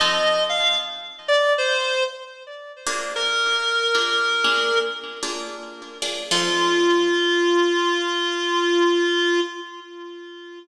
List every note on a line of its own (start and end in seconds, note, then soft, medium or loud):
0.00 0.62 F3 loud
0.00 0.62 C4 loud
0.00 0.62 D#4 loud
0.00 0.62 A4 loud
0.00 0.43 D#5 loud
0.49 0.77 F5 loud
1.28 1.53 D5 loud
1.58 2.03 C5 loud
2.87 3.77 A#3 loud
2.87 3.77 D4 loud
2.87 3.77 F4 medium
2.87 3.77 G#4 loud
3.16 4.79 A#4 loud
3.95 4.29 A#3 medium
3.95 4.29 D4 loud
3.95 4.29 F4 medium
3.95 4.29 G#4 medium
4.44 4.94 A#3 medium
4.44 4.94 D4 loud
4.44 4.94 F4 medium
4.44 4.94 G#4 loud
5.23 5.72 A#3 loud
5.23 5.72 D4 medium
5.23 5.72 F4 medium
5.23 5.72 G#4 medium
6.02 6.23 A#3 medium
6.02 6.23 D4 medium
6.02 6.23 F4 medium
6.02 6.23 G#4 medium
6.31 9.40 F3 loud
6.31 9.40 C4 medium
6.31 9.40 D#4 loud
6.31 9.40 F4 loud
6.31 9.40 A4 loud